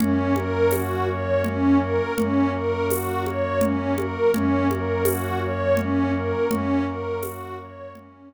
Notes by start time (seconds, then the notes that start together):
0.00 F#2 A#3 C#4 F#4, low conga
0.36 A#4, high conga
0.71 F#4, tambourine, high conga
1.09 C#5
1.44 C#4, low conga
1.81 A#4
2.17 F#2 F#3 A#3 C#4 F#4, low conga
2.53 A#4
2.89 F#4, tambourine, high conga
3.25 C#5, high conga
3.61 C#4, low conga
3.98 A#4, high conga
4.34 F#2 A#3 C#4 F#4, low conga
4.70 A#4, high conga
5.05 F#4, tambourine, high conga
5.42 C#5
5.77 C#4, low conga
6.14 A#4
6.50 F#2 F#3 A#3 C#4 F#4, low conga
6.87 A#4
7.23 F#4, tambourine, high conga
7.59 C#5
7.95 C#4, low conga
8.31 A#4